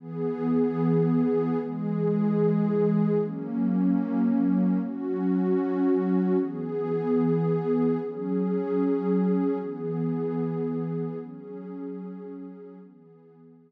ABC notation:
X:1
M:6/8
L:1/8
Q:3/8=75
K:Elyd
V:1 name="Pad 2 (warm)"
[E,B,G]6 | [E,G,G]6 | [F,A,C]6 | [F,CF]6 |
[E,B,G]6 | [F,CG]6 | [E,B,G]6 | [F,CG]6 |
[E,B,G]6 |]